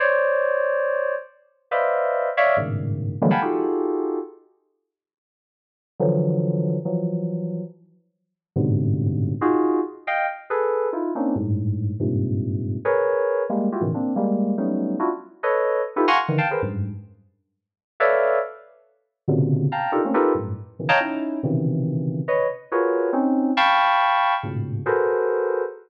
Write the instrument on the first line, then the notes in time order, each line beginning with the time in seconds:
electric piano 2
0.00 C5 C#5 D5
1.71 B4 C5 D5 D#5 E5 F5
2.37 C#5 D5 E5 F5
2.57 G2 G#2 A2 B2 C#3 D#3
3.22 D3 E3 F#3 G3 G#3 A#3
3.31 F5 F#5 G5 G#5 A5 B5
3.42 D#4 F4 F#4 G4 G#4 A4
6.00 D3 E3 F3 F#3
6.85 E3 F3 F#3
8.56 G2 G#2 A2 B2 C3 D3
9.41 D#4 F4 F#4 G#4
10.07 D#5 F5 G5
10.50 G#4 A4 B4
10.93 D#4 E4 F4
11.15 A#3 C4 C#4 D4 D#4
11.36 G2 G#2 A2
12.00 G2 G#2 A#2 C3
12.85 G#4 A#4 B4 C#5
13.49 G3 G#3 A#3
13.72 E4 F4 F#4 G4
13.81 A2 B2 C#3 D#3 E3
13.94 A#3 C4 D4
14.16 G3 G#3 A#3
14.58 F#3 G3 A3 B3 C#4 D#4
14.99 D4 E4 F4 F#4
15.43 A4 B4 C#5 D#5
15.96 D#4 E4 F4 G4 A4 B4
16.08 F5 F#5 G#5 A#5 C6 C#6
16.28 D3 D#3 E3
16.38 F5 G5 A5
16.51 G#4 A#4 B4 C5
16.62 F#2 G2 G#2
18.00 A4 B4 C#5 D5 E5 F5
19.28 A#2 B2 C3 C#3 D3
19.72 F5 G5 A5 A#5
19.92 D4 D#4 F4 G4 A4 A#4
20.04 A3 A#3 C4 C#4
20.14 D#4 F4 G4 A4 A#4 B4
20.35 F#2 G2 A2
20.79 B2 C#3 D#3 E3
20.89 C#5 D#5 F5 G5 A5 A#5
21.00 C#4 D#4 E4
21.43 B2 C3 C#3 D#3 E3
22.28 B4 C#5 D#5
22.72 F4 F#4 G#4 A#4 B4 C#5
23.13 C4 C#4 D#4
23.57 F5 G5 A5 B5 C#6
24.43 G#2 A2 A#2 B2 C#3
24.86 F#4 G#4 A4 A#4 B4 C5